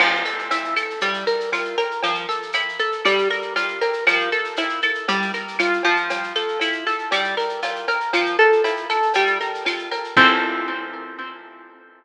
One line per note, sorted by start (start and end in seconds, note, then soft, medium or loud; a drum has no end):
0.00 0.23 F3 loud
0.00 crash loud
0.00 cowbell loud
0.00 claves loud
0.14 shaker medium
0.25 0.48 A4 medium
0.25 shaker medium
0.39 shaker medium
0.51 0.74 E4 loud
0.51 cowbell medium
0.51 shaker loud
0.64 shaker medium
0.76 0.99 A4 medium
0.76 claves loud
0.76 shaker loud
0.90 shaker medium
1.01 1.25 G3 loud
1.01 cowbell medium
1.01 shaker loud
1.14 shaker medium
1.27 1.50 A#4 medium
1.27 shaker medium
1.40 shaker medium
1.52 1.76 F4 medium
1.52 cowbell medium
1.52 claves medium
1.52 shaker loud
1.65 shaker medium
1.78 2.01 A#4 medium
1.78 cowbell medium
1.78 shaker medium
1.91 shaker medium
2.03 2.26 F3 loud
2.03 cowbell loud
2.03 shaker loud
2.15 shaker medium
2.29 2.52 A4 medium
2.29 shaker medium
2.42 shaker medium
2.53 2.77 E4 medium
2.53 cowbell medium
2.53 claves loud
2.53 shaker loud
2.69 shaker medium
2.79 3.02 A4 medium
2.79 shaker medium
2.92 shaker medium
3.05 3.28 G3 loud
3.05 cowbell medium
3.05 claves medium
3.05 shaker loud
3.18 shaker medium
3.30 3.53 A#4 medium
3.30 shaker medium
3.42 shaker medium
3.56 3.79 F4 medium
3.56 cowbell medium
3.56 shaker loud
3.68 shaker medium
3.81 4.04 A#4 medium
3.81 cowbell medium
3.81 shaker medium
3.93 shaker medium
4.07 4.30 F3 loud
4.07 cowbell loud
4.07 claves loud
4.07 shaker loud
4.20 shaker medium
4.32 4.55 A4 medium
4.32 shaker medium
4.44 shaker medium
4.56 4.81 E4 medium
4.56 cowbell medium
4.56 shaker loud
4.69 shaker medium
4.82 5.06 A4 medium
4.82 claves loud
4.82 shaker medium
4.95 shaker medium
5.08 5.31 G3 loud
5.08 cowbell medium
5.08 shaker loud
5.22 shaker medium
5.34 5.57 A#4 medium
5.34 shaker medium
5.48 shaker medium
5.59 5.82 F4 medium
5.59 cowbell medium
5.59 claves loud
5.59 shaker loud
5.73 shaker medium
5.83 6.33 F3 loud
5.83 cowbell medium
5.83 shaker medium
5.96 shaker medium
6.10 cowbell loud
6.10 shaker loud
6.23 shaker medium
6.35 6.59 A4 medium
6.35 shaker medium
6.48 shaker medium
6.59 6.84 E4 medium
6.59 cowbell medium
6.59 claves medium
6.59 shaker loud
6.72 shaker medium
6.87 7.09 A4 medium
6.87 shaker medium
6.99 shaker medium
7.11 7.35 G3 loud
7.11 cowbell medium
7.11 claves medium
7.11 shaker loud
7.24 shaker medium
7.37 7.60 A#4 medium
7.37 shaker medium
7.49 shaker medium
7.62 7.86 F4 medium
7.62 cowbell medium
7.62 shaker loud
7.76 shaker medium
7.88 8.11 A#4 loud
7.88 cowbell medium
7.88 shaker medium
8.00 shaker medium
8.13 8.36 F3 loud
8.13 cowbell loud
8.13 claves loud
8.13 shaker loud
8.26 shaker medium
8.39 8.62 A4 loud
8.39 shaker medium
8.52 shaker medium
8.64 8.87 E4 medium
8.64 cowbell medium
8.64 shaker loud
8.76 shaker medium
8.90 9.13 A4 loud
8.90 claves medium
8.90 shaker medium
9.02 shaker medium
9.14 9.38 G3 loud
9.14 cowbell medium
9.14 shaker loud
9.26 shaker medium
9.41 9.64 A#4 medium
9.41 shaker medium
9.54 shaker medium
9.65 9.89 F4 loud
9.65 cowbell medium
9.65 claves medium
9.65 shaker loud
9.78 shaker medium
9.91 10.14 A#4 loud
9.91 cowbell medium
9.91 shaker medium
10.04 shaker medium
10.17 12.04 F3 medium
10.17 12.04 C4 loud
10.17 12.04 E4 loud
10.17 12.04 A4 medium
10.17 kick loud
10.17 crash loud